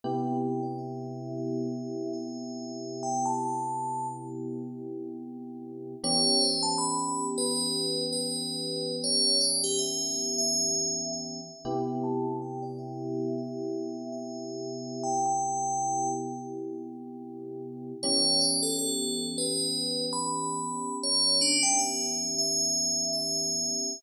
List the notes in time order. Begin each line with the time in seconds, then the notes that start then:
0.04 C3 B3 E4 G4 G5
0.41 G5
0.63 D5
0.78 E5
1.38 E5
2.13 E5
3.03 G5
3.25 A5
6.04 E3 B3 C#4 G4 C#5
6.41 C5
6.63 A5
6.78 B5
7.38 B4
8.12 B4
9.04 C#5
9.41 D5
9.64 G4
9.79 E5
10.38 E5
11.13 E5
11.65 C3 B3 E4 G4
12.04 A5
12.42 G5
12.62 D5
12.79 E5
13.38 E5
14.12 E5
15.03 G5
15.26 G5
18.03 E3 B3 C#4 G4 C#5
18.41 D5
18.63 A4
18.79 A4
19.38 B4
20.13 B5
21.03 C#5
21.41 D4
21.63 G5
21.79 E5
22.38 E5
23.13 E5